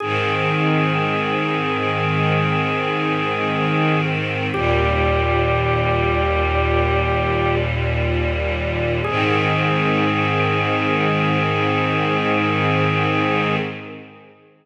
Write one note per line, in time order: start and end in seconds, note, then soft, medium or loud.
0.00 4.49 G#2 medium
0.00 4.49 D#3 loud
0.00 4.49 C4 medium
0.00 4.01 G#4 medium
4.52 9.00 D#2 medium
4.52 9.00 A#2 medium
4.52 9.00 G3 medium
4.52 7.55 G4 loud
9.04 13.57 G#2 loud
9.04 13.57 D#3 medium
9.04 13.57 C4 medium
9.04 13.56 G#4 loud